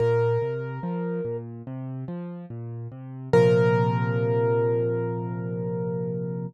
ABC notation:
X:1
M:4/4
L:1/8
Q:1/4=72
K:Bb
V:1 name="Acoustic Grand Piano"
B4 z4 | B8 |]
V:2 name="Acoustic Grand Piano" clef=bass
B,, C, F, B,, C, F, B,, C, | [B,,C,F,]8 |]